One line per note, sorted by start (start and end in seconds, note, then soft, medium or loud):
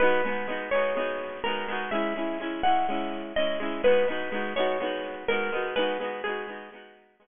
0.00 0.22 G#3 medium
0.00 0.22 B3 medium
0.00 0.22 D#4 medium
0.00 0.22 F#4 medium
0.00 0.59 B4 loud
0.25 0.47 G#3 medium
0.25 0.47 B3 medium
0.25 0.47 D#4 medium
0.29 0.47 F#4 medium
0.48 0.70 G#3 medium
0.48 0.70 B3 medium
0.48 0.70 D#4 medium
0.52 0.70 F#4 medium
0.71 0.95 G#3 medium
0.71 0.95 B3 medium
0.71 1.40 C#5 loud
0.75 0.95 D#4 medium
0.75 0.95 F#4 medium
0.96 1.40 G#3 medium
0.96 1.40 B3 medium
0.96 1.40 D#4 medium
1.00 1.40 F#4 medium
1.44 1.67 G#3 medium
1.44 1.67 B3 medium
1.44 1.67 D#4 medium
1.44 1.84 A#4 loud
1.49 1.67 F#4 medium
1.68 1.90 G#3 medium
1.68 1.90 B3 medium
1.68 1.90 D#4 medium
1.72 1.90 F#4 medium
1.91 2.14 G#3 medium
1.91 2.14 C#4 medium
1.91 2.14 E4 medium
1.91 2.62 E5 loud
2.16 2.38 G#3 medium
2.16 2.38 C#4 medium
2.16 2.38 E4 medium
2.40 2.62 G#3 medium
2.40 2.62 C#4 medium
2.40 2.62 E4 medium
2.63 2.86 G#3 medium
2.63 2.86 C#4 medium
2.63 2.86 E4 medium
2.63 3.22 F#5 loud
2.89 3.33 G#3 medium
2.89 3.33 C#4 medium
2.89 3.33 E4 medium
3.36 3.59 G#3 medium
3.36 3.59 C#4 medium
3.36 3.59 E4 medium
3.36 3.80 D#5 loud
3.60 3.82 G#3 medium
3.60 3.82 C#4 medium
3.60 3.82 E4 medium
3.83 4.06 G#3 medium
3.83 4.06 B3 medium
3.83 4.06 D#4 medium
3.83 4.53 B4 loud
3.88 4.06 F#4 medium
4.08 4.30 G#3 medium
4.08 4.30 B3 medium
4.08 4.30 D#4 medium
4.12 4.30 F#4 medium
4.32 4.54 G#3 medium
4.32 4.54 B3 medium
4.32 4.54 D#4 medium
4.36 4.54 F#4 medium
4.56 4.78 G#3 medium
4.56 4.78 B3 medium
4.56 4.78 D#4 medium
4.56 5.15 C#5 loud
4.60 4.78 F#4 medium
4.80 5.24 G#3 medium
4.80 5.24 B3 medium
4.80 5.24 D#4 medium
4.84 5.24 F#4 medium
5.28 5.51 G#3 medium
5.28 5.51 B3 medium
5.28 5.51 D#4 medium
5.28 5.69 A#4 loud
5.33 5.51 F#4 medium
5.52 5.74 G#3 medium
5.52 5.74 B3 medium
5.52 5.74 D#4 medium
5.56 5.74 F#4 medium
5.76 5.98 G#3 medium
5.76 5.98 B3 medium
5.76 5.98 D#4 medium
5.76 6.19 B4 loud
5.80 5.98 F#4 medium
6.00 6.22 G#3 medium
6.00 6.22 B3 medium
6.00 6.22 D#4 medium
6.04 6.22 F#4 medium
6.24 6.47 G#3 medium
6.24 6.47 B3 medium
6.24 6.47 D#4 medium
6.24 6.71 G#4 loud
6.29 6.47 F#4 medium
6.47 6.69 G#3 medium
6.47 6.69 B3 medium
6.47 6.69 D#4 medium
6.52 6.69 F#4 medium
6.72 7.16 G#3 medium
6.72 7.16 B3 medium
6.72 7.16 D#4 medium
6.76 7.16 F#4 medium
7.20 7.27 G#3 medium
7.20 7.27 B3 medium
7.20 7.27 D#4 medium
7.24 7.27 F#4 medium